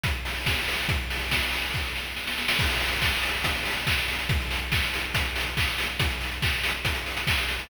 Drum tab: CC |--------|----------------|x---------------|----------------|
HH |x-o---o-|x-o---o---------|-xox-xoxxxox-xox|xxox-xoxxxox-xox|
CP |--------|----------------|----x-------x---|----x-------x---|
SD |----o---|----o---o-o-oooo|--------------o-|--------------o-|
BD |o---o---|o---o---o-------|o---o---o---o---|o---o---o---o---|

CC |----------------|
HH |xxox-xoxxxox-xoo|
CP |----x-------x---|
SD |--------------o-|
BD |o---o---o---o---|